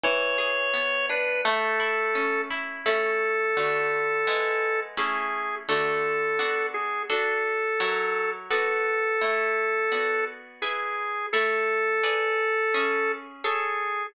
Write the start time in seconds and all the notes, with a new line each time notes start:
0.04 E3 C#5
0.38 G#4
0.74 B3
1.09 D4 B4
1.45 A3 A4
1.80 E4
2.15 C#4
2.50 E4
2.86 A3 C#4 E4 A4
3.57 D3 A3 F#4
4.27 G#3 B3 E4
4.97 A3 C#4 E4 G#4
5.69 D3 A3 F#4 A4
6.39 B3 D4 F#4
6.74 G#4
7.09 D4 F#4 A4
7.80 F#3 E4 A#4 C#5
8.50 B3 F#4 A4 D5
9.21 A3 E4 C#5
9.92 B3 F#4 D5
10.62 E4 G#4 B4
11.33 A3 E4 A4 C#5
12.03 G#4 B4 D5
12.74 C#4 G#4 E5
13.44 G#4 A4 C#5 E5